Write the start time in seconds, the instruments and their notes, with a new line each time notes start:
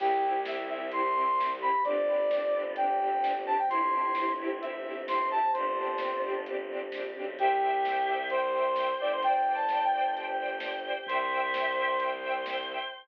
0.00 violin C2, choir aahs C4 E4 G4, string ensemble 1 C4 E4 G4, brass section G4, kick, crash
0.23 string ensemble 1 C4 E4 G4
0.45 string ensemble 1 C4 E4 G4, brass section E5, snare
0.69 string ensemble 1 C4 E4 G4, brass section E5
0.92 string ensemble 1 C4 E4 G4, choir aahs C4 G4 C5, brass section C6, closed hi-hat
1.15 string ensemble 1 C4 E4 G4
1.38 string ensemble 1 C4 E4 G4, snare
1.61 string ensemble 1 C4 E4 G4, brass section B5
1.83 violin G1, choir aahs C4 D4 G4, string ensemble 1 C4 D4 G4, brass section D5, kick, closed hi-hat
2.07 string ensemble 1 C4 D4 G4
2.31 string ensemble 1 C4 D4 G4, snare
2.54 string ensemble 1 C4 D4 G4
2.76 choir aahs G3 C4 G4, string ensemble 1 C4 D4 G4, brass section G5, closed hi-hat
3.00 string ensemble 1 C4 D4 G4
3.23 string ensemble 1 C4 D4 G4, snare
3.46 string ensemble 1 C4 D4 G4, brass section A5
3.58 brass section G5
3.69 violin G1, choir aahs C4 E4 G4, string ensemble 1 C4 E4 G4, brass section C6, kick, closed hi-hat
3.92 string ensemble 1 C4 E4 G4
4.15 string ensemble 1 C4 E4 G4, snare
4.39 string ensemble 1 C4 E4 G4
4.61 string ensemble 1 C4 E4 G4, choir aahs C4 G4 C5, brass section E5, closed hi-hat
4.85 string ensemble 1 C4 E4 G4
5.08 string ensemble 1 C4 E4 G4, brass section C6, snare
5.30 string ensemble 1 C4 E4 G4, brass section A5
5.53 violin G1, string ensemble 1 C4 D4 G4, choir aahs C4 D4 G4, brass section C5, kick, closed hi-hat
5.77 string ensemble 1 C4 D4 G4
5.98 string ensemble 1 C4 D4 G4, snare
6.23 string ensemble 1 C4 D4 G4
6.46 choir aahs G3 C4 G4, string ensemble 1 C4 D4 G4, closed hi-hat
6.70 string ensemble 1 C4 D4 G4
6.92 violin A#1, string ensemble 1 C4 D4 G4, snare
7.15 violin B1, string ensemble 1 C4 D4 G4
7.37 violin C2, brass section G4, choir aahs C5 E5 G5, string ensemble 1 C5 E5 G5, kick, closed hi-hat
7.62 string ensemble 1 C5 E5 G5
7.84 string ensemble 1 C5 E5 G5, snare
8.07 string ensemble 1 C5 E5 G5
8.30 choir aahs C5 G5 C6, string ensemble 1 C5 E5 G5, brass section C5, closed hi-hat
8.54 string ensemble 1 C5 E5 G5
8.76 string ensemble 1 C5 E5 G5, snare
9.00 violin G1, string ensemble 1 C5 E5 G5, brass section D5
9.12 brass section C5
9.22 choir aahs C5 D5 G5, string ensemble 1 C5 D5 G5, brass section G5, kick, closed hi-hat
9.47 string ensemble 1 C5 D5 G5
9.54 brass section A5
9.69 string ensemble 1 C5 D5 G5, snare
9.84 brass section G5
9.93 string ensemble 1 C5 D5 G5
10.15 choir aahs G4 C5 G5, string ensemble 1 C5 D5 G5, closed hi-hat
10.39 string ensemble 1 C5 D5 G5
10.60 string ensemble 1 C5 D5 G5, snare
10.85 string ensemble 1 C5 D5 G5
11.06 violin C2, choir aahs C5 E5 G5, string ensemble 1 C5 E5 G5, brass section C5, kick, closed hi-hat
11.31 string ensemble 1 C5 E5 G5
11.54 string ensemble 1 C5 E5 G5, snare
11.77 string ensemble 1 C5 E5 G5
12.00 string ensemble 1 C5 E5 G5, choir aahs C5 G5 C6, closed hi-hat
12.22 string ensemble 1 C5 E5 G5
12.46 string ensemble 1 C5 E5 G5, snare
12.69 string ensemble 1 C5 E5 G5